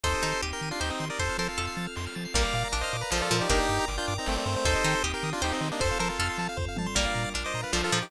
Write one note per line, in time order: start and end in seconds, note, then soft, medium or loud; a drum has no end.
0.03 0.15 D#2 medium
0.03 1.18 C4 medium
0.03 0.22 D#4 loud
0.03 1.18 D#4 loud
0.03 1.18 G4 medium
0.03 0.41 A4 loud
0.03 0.41 C5 loud
0.03 0.13 C6 loud
0.03 kick loud
0.03 closed hi-hat loud
0.14 0.22 D#6 medium
0.22 0.34 D#3 medium
0.22 0.38 D#4 loud
0.22 0.31 G6 medium
0.22 closed hi-hat medium
0.32 0.41 C7 medium
0.42 0.53 D#2 medium
0.42 0.75 G4 medium
0.42 0.51 D#7 medium
0.42 closed hi-hat loud
0.53 0.69 G4 medium
0.53 0.69 A#4 medium
0.53 0.61 G7 medium
0.61 0.72 D#3 medium
0.61 0.71 D#7 medium
0.61 closed hi-hat medium
0.71 0.80 D4 medium
0.71 0.80 F4 medium
0.71 0.80 C7 medium
0.80 0.91 D#2 medium
0.80 0.89 D#4 medium
0.80 0.89 G4 medium
0.80 1.14 C5 loud
0.80 0.91 G6 medium
0.80 snare loud
0.90 1.06 C4 medium
0.90 1.06 D#4 medium
0.90 0.99 D#6 medium
1.00 1.10 D#3 medium
1.00 1.08 C6 medium
1.00 open hi-hat medium
1.10 1.19 A#4 medium
1.10 1.19 D5 medium
1.10 1.18 D#6 medium
1.19 1.30 F2 medium
1.19 2.33 C4 medium
1.19 2.33 F4 medium
1.19 2.33 A4 medium
1.19 1.37 A4 medium
1.19 1.36 C5 loud
1.19 1.37 C5 loud
1.19 1.28 C6 medium
1.19 kick loud
1.19 closed hi-hat loud
1.29 1.38 F6 medium
1.38 1.49 F3 medium
1.38 1.48 A4 medium
1.38 1.56 A#4 medium
1.38 1.48 C5 loud
1.38 1.47 A6 medium
1.38 closed hi-hat medium
1.48 1.87 F4 medium
1.48 1.87 A4 medium
1.48 1.58 C7 medium
1.57 1.69 F2 medium
1.57 1.94 A4 loud
1.57 1.66 F7 medium
1.57 closed hi-hat loud
1.67 1.76 C7 medium
1.77 1.87 F3 medium
1.77 1.85 A6 medium
1.77 closed hi-hat medium
1.87 1.96 F6 medium
1.96 2.08 F2 medium
1.96 2.05 C6 medium
1.96 snare loud
2.06 2.15 F6 medium
2.15 2.27 F3 medium
2.15 2.24 A6 medium
2.15 closed hi-hat medium
2.25 2.34 C7 medium
2.34 2.45 A#1 loud
2.34 2.73 G3 loud
2.34 2.73 A#3 loud
2.34 2.43 A#4 loud
2.34 3.49 A#4 loud
2.34 2.68 D5 medium
2.34 3.49 D5 loud
2.34 2.68 F5 medium
2.34 3.49 F5 loud
2.34 kick loud
2.34 closed hi-hat loud
2.45 2.54 D5 medium
2.53 2.64 A#2 medium
2.53 2.63 F5 loud
2.53 closed hi-hat loud
2.64 2.73 A#5 medium
2.72 2.83 A#1 medium
2.72 3.04 D4 loud
2.72 2.82 D6 medium
2.72 closed hi-hat loud
2.81 2.97 C5 medium
2.81 2.97 D#5 medium
2.81 2.92 F6 loud
2.93 3.04 A#2 medium
2.93 3.02 D6 medium
2.93 closed hi-hat loud
3.01 3.10 B4 medium
3.01 3.11 A#5 loud
3.11 3.22 A#1 medium
3.11 3.29 F3 loud
3.11 3.21 A4 medium
3.11 3.22 C5 medium
3.11 3.21 F5 loud
3.11 snare loud
3.20 3.37 F4 medium
3.20 3.37 A4 loud
3.20 3.29 D5 medium
3.31 3.42 A#2 medium
3.31 3.47 F3 loud
3.31 3.40 A#4 medium
3.31 closed hi-hat loud
3.40 3.50 D#4 medium
3.40 3.50 G4 medium
3.40 3.49 D5 loud
3.49 3.60 G1 loud
3.49 4.60 A#3 loud
3.49 4.60 D4 loud
3.49 3.85 D#4 loud
3.49 3.85 G4 loud
3.49 4.64 A#4 loud
3.49 3.59 A#4 loud
3.49 4.64 D5 loud
3.49 4.64 G5 loud
3.49 kick loud
3.49 closed hi-hat loud
3.59 3.68 D5 medium
3.69 3.80 G2 medium
3.69 3.77 G5 medium
3.69 closed hi-hat loud
3.80 3.88 A#5 loud
3.88 3.99 G1 medium
3.88 3.96 D6 medium
3.88 closed hi-hat loud
3.98 4.14 D4 medium
3.98 4.14 F4 medium
3.98 4.06 G6 loud
4.08 4.19 G2 medium
4.08 4.16 D6 loud
4.08 closed hi-hat loud
4.18 4.27 C4 medium
4.18 4.28 D#4 medium
4.18 4.27 A#5 loud
4.26 4.38 G1 loud
4.26 4.37 A3 medium
4.26 4.37 C4 loud
4.26 4.35 G5 medium
4.26 snare loud
4.36 4.55 A3 medium
4.36 4.55 C4 medium
4.36 4.45 D5 medium
4.46 4.56 G2 loud
4.46 4.74 C5 loud
4.46 closed hi-hat loud
4.56 4.65 A3 medium
4.56 4.65 C4 medium
4.65 4.75 D#2 loud
4.65 5.80 C4 loud
4.65 4.84 D#4 loud
4.65 5.80 D#4 loud
4.65 5.80 G4 loud
4.65 5.03 A4 loud
4.65 5.03 C5 loud
4.65 kick loud
4.65 closed hi-hat loud
4.75 4.84 D#5 loud
4.84 4.95 D#3 medium
4.84 5.00 D#4 loud
4.84 4.94 G5 loud
4.84 closed hi-hat loud
4.95 5.03 C6 medium
5.03 5.14 D#2 medium
5.03 5.36 G4 loud
5.03 5.12 D#6 loud
5.03 closed hi-hat loud
5.14 5.30 G4 medium
5.14 5.30 A#4 medium
5.14 5.23 G6 medium
5.22 5.34 D#3 medium
5.22 5.32 D#6 loud
5.22 closed hi-hat loud
5.33 5.42 D4 medium
5.33 5.42 F4 loud
5.33 5.43 C6 loud
5.42 5.53 D#2 medium
5.42 5.52 D#4 medium
5.42 5.53 G4 loud
5.42 5.75 C5 loud
5.42 5.51 G5 medium
5.42 snare loud
5.52 5.69 C4 medium
5.52 5.69 D#4 loud
5.52 5.61 D#5 medium
5.61 5.71 D#3 medium
5.61 5.70 C5 medium
5.61 closed hi-hat loud
5.71 5.81 A#3 medium
5.71 5.81 D4 medium
5.71 5.80 D#5 loud
5.80 5.91 F2 loud
5.80 6.95 C4 loud
5.80 6.95 F4 loud
5.80 5.98 A4 loud
5.80 6.95 A4 loud
5.80 5.89 C5 loud
5.80 5.98 C5 loud
5.80 kick loud
5.80 closed hi-hat loud
5.91 6.00 F5 medium
5.99 6.10 F3 medium
5.99 6.08 A4 loud
5.99 6.18 A#4 loud
5.99 6.08 C5 loud
5.99 6.09 A5 medium
5.99 closed hi-hat loud
6.09 6.48 F4 medium
6.09 6.48 A4 medium
6.09 6.18 C6 medium
6.19 6.30 F2 medium
6.19 6.56 A4 loud
6.19 6.28 F6 loud
6.19 closed hi-hat loud
6.29 6.38 C6 loud
6.38 6.48 F3 medium
6.38 6.48 A5 loud
6.38 closed hi-hat loud
6.49 6.57 F5 loud
6.57 6.68 F2 medium
6.57 6.66 C5 loud
6.57 kick loud
6.57 floor tom loud
6.68 6.77 F5 medium
6.76 6.88 F3 medium
6.76 6.87 A5 medium
6.76 high tom loud
6.86 6.95 C6 loud
6.95 7.07 A#1 medium
6.95 7.33 G3 loud
6.95 7.33 A#3 loud
6.95 8.10 D4 medium
6.95 8.10 F4 medium
6.95 8.10 A#4 medium
6.95 7.29 D5 medium
6.95 7.05 D5 loud
6.95 7.29 F5 medium
6.95 kick loud
6.95 closed hi-hat loud
7.06 7.14 F5 medium
7.14 7.26 A#2 medium
7.14 7.23 A#5 medium
7.14 closed hi-hat medium
7.24 7.33 D6 medium
7.34 7.45 A#1 medium
7.34 7.67 D4 loud
7.34 7.43 F6 medium
7.34 closed hi-hat loud
7.44 7.61 C5 medium
7.44 7.61 D#5 medium
7.44 7.53 D6 medium
7.54 7.65 A#2 medium
7.54 7.63 A#5 medium
7.54 closed hi-hat medium
7.63 7.73 B4 medium
7.63 7.71 F5 medium
7.73 7.83 A#1 medium
7.73 7.91 F3 loud
7.73 7.82 A4 medium
7.73 7.82 C5 medium
7.73 7.81 D5 medium
7.73 snare loud
7.83 7.99 F4 medium
7.83 7.99 A4 loud
7.83 7.91 F5 medium
7.92 8.03 A#2 medium
7.92 8.08 F3 loud
7.92 8.01 A#5 medium
7.92 open hi-hat medium
8.01 8.10 D#4 medium
8.01 8.10 G4 medium
8.01 8.10 D6 loud